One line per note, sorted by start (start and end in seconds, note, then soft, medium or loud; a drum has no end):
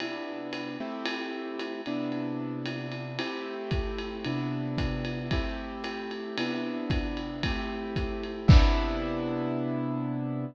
0.00 0.76 C3 medium
0.00 0.76 B3 medium
0.00 0.76 D4 medium
0.00 0.76 E4 medium
0.00 ride medium
0.53 hi-hat pedal medium
0.53 ride medium
0.80 1.81 A3 medium
0.80 1.81 C4 medium
0.80 1.81 E4 medium
0.80 1.81 G4 medium
1.06 ride loud
1.59 hi-hat pedal medium
1.59 ride medium
1.86 3.18 C3 medium
1.86 3.18 B3 medium
1.86 3.18 D4 medium
1.86 3.18 E4 medium
1.86 ride medium
2.12 ride medium
2.66 hi-hat pedal medium
2.66 ride medium
2.92 ride medium
3.19 4.23 A3 medium
3.19 4.23 C4 medium
3.19 4.23 E4 medium
3.19 4.23 G4 medium
3.19 ride loud
3.71 kick medium
3.71 hi-hat pedal medium
3.71 ride medium
3.98 ride medium
4.25 5.30 C3 medium
4.25 5.30 B3 medium
4.25 5.30 D4 medium
4.25 5.30 E4 medium
4.25 ride medium
4.78 kick medium
4.78 hi-hat pedal medium
4.78 ride medium
5.05 ride medium
5.31 6.37 A3 medium
5.31 6.37 C4 medium
5.31 6.37 E4 medium
5.31 6.37 G4 medium
5.31 kick medium
5.31 ride medium
5.84 hi-hat pedal medium
5.84 ride medium
6.11 ride medium
6.38 7.42 C3 medium
6.38 7.42 B3 medium
6.38 7.42 D4 medium
6.38 7.42 E4 medium
6.38 ride loud
6.90 kick medium
6.90 hi-hat pedal medium
6.90 ride medium
7.17 ride medium
7.43 8.49 A3 medium
7.43 8.49 C4 medium
7.43 8.48 E4 medium
7.43 8.49 G4 medium
7.43 kick medium
7.43 ride loud
7.96 kick medium
7.96 hi-hat pedal medium
7.96 ride medium
8.23 ride medium
8.48 10.45 C3 loud
8.48 10.45 B3 loud
8.48 10.45 D4 medium
8.48 10.45 E4 loud
8.48 kick loud
8.48 crash loud